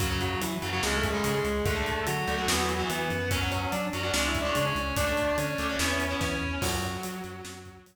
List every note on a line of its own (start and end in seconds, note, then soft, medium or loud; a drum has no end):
0.00 0.35 F#2 medium
0.00 0.08 C#3 medium
0.00 0.08 F#3 loud
0.00 0.20 F#3 medium
0.00 0.20 F#4 loud
0.00 kick loud
0.00 closed hi-hat loud
0.10 0.43 C#3 medium
0.10 0.43 F#3 medium
0.21 0.40 F#3 medium
0.21 0.40 F#4 medium
0.21 closed hi-hat medium
0.41 0.51 E3 medium
0.41 0.59 F#3 medium
0.41 0.51 E4 medium
0.41 closed hi-hat loud
0.62 0.80 F#2 medium
0.62 0.70 C#3 loud
0.62 0.70 F#3 loud
0.62 closed hi-hat medium
0.73 0.81 C#3 medium
0.73 0.81 F#3 medium
0.73 0.82 F#3 medium
0.73 0.82 F#4 medium
0.83 1.19 C#2 medium
0.83 1.08 C#3 loud
0.83 0.96 G#3 medium
0.83 1.08 G#3 loud
0.83 0.96 G#4 medium
0.83 snare medium
0.96 1.09 A3 medium
0.96 1.09 A4 medium
1.03 kick medium
1.03 closed hi-hat medium
1.10 1.47 C#3 loud
1.10 1.23 G#3 medium
1.10 1.47 G#3 medium
1.10 1.23 G#4 medium
1.24 1.42 C#3 medium
1.24 1.34 G#3 medium
1.24 1.34 G#4 medium
1.24 closed hi-hat loud
1.35 1.62 G#3 medium
1.35 1.62 G#4 medium
1.44 1.62 C#2 medium
1.44 closed hi-hat medium
1.65 2.01 D2 medium
1.65 1.74 D3 loud
1.65 1.74 A3 medium
1.65 2.02 A3 medium
1.65 2.02 A4 loud
1.65 kick loud
1.65 closed hi-hat medium
1.76 2.09 D3 medium
1.76 2.09 A3 medium
1.86 closed hi-hat medium
2.07 2.25 D3 medium
2.07 2.86 F#3 medium
2.07 2.86 F#4 medium
2.07 closed hi-hat loud
2.28 2.45 D2 medium
2.28 2.36 D3 medium
2.28 2.36 A3 loud
2.28 closed hi-hat medium
2.38 2.46 D3 medium
2.38 2.46 A3 loud
2.48 2.83 E2 medium
2.48 2.73 E3 loud
2.48 2.73 B3 loud
2.48 snare loud
2.69 closed hi-hat medium
2.79 3.12 E3 loud
2.79 3.12 B3 medium
2.90 3.07 E3 medium
2.90 3.29 B3 medium
2.90 3.29 B4 medium
2.90 closed hi-hat medium
3.10 3.66 F#2 medium
3.10 closed hi-hat medium
3.31 3.39 F#3 loud
3.31 3.39 C#4 loud
3.31 3.51 C#4 medium
3.31 3.51 C#5 medium
3.31 kick medium
3.31 closed hi-hat loud
3.41 3.74 F#3 loud
3.41 3.74 C#4 medium
3.52 3.69 C#4 medium
3.52 3.69 C#5 medium
3.52 closed hi-hat medium
3.72 3.90 F#3 medium
3.72 3.82 D4 medium
3.72 3.82 D5 medium
3.72 closed hi-hat medium
3.93 4.11 F#2 medium
3.93 4.01 F#3 medium
3.93 4.01 C#4 medium
3.93 closed hi-hat medium
4.03 4.12 F#3 medium
4.03 4.12 C#4 medium
4.03 4.13 D4 medium
4.03 4.13 D5 medium
4.14 4.49 C#2 medium
4.14 4.38 G#3 loud
4.14 4.38 C#4 loud
4.14 4.27 D4 medium
4.14 4.27 D5 medium
4.14 snare loud
4.27 4.41 E4 medium
4.27 4.41 E5 medium
4.35 kick medium
4.35 closed hi-hat medium
4.41 4.78 G#3 medium
4.41 4.78 C#4 loud
4.41 4.54 D4 medium
4.41 4.54 D5 medium
4.55 4.73 C#3 medium
4.55 4.65 D4 medium
4.55 4.65 D5 medium
4.55 closed hi-hat medium
4.66 4.95 C#4 medium
4.66 4.95 C#5 medium
4.75 4.93 C#2 medium
4.75 closed hi-hat medium
4.97 5.32 D2 medium
4.97 5.05 A3 loud
4.97 5.36 D4 medium
4.97 5.05 D4 loud
4.97 5.36 D5 medium
4.97 kick medium
4.97 closed hi-hat loud
5.07 5.40 A3 medium
5.07 5.40 D4 medium
5.17 closed hi-hat medium
5.38 5.55 D3 medium
5.38 6.19 C#4 medium
5.38 6.19 C#5 medium
5.38 closed hi-hat medium
5.58 5.76 D2 medium
5.58 5.67 A3 medium
5.58 5.67 D4 medium
5.58 closed hi-hat medium
5.69 5.78 A3 medium
5.69 5.78 D4 medium
5.79 6.15 E2 medium
5.79 6.04 B3 loud
5.79 6.04 E4 loud
5.79 snare loud
6.00 closed hi-hat medium
6.11 6.44 B3 medium
6.11 6.44 E4 medium
6.21 6.38 E3 medium
6.21 6.61 C#4 medium
6.21 6.61 C#5 medium
6.21 kick medium
6.21 snare medium
6.41 6.59 E2 medium
6.62 6.97 F#2 medium
6.62 7.80 F#3 medium
6.62 7.80 F#4 medium
6.62 kick medium
6.62 crash loud
6.82 closed hi-hat medium
7.03 7.22 F#3 medium
7.03 closed hi-hat loud
7.24 7.42 F#2 medium
7.24 closed hi-hat medium
7.44 7.80 F#2 medium
7.44 snare loud
7.65 kick medium
7.65 closed hi-hat medium
7.86 7.96 F#3 medium
7.86 closed hi-hat loud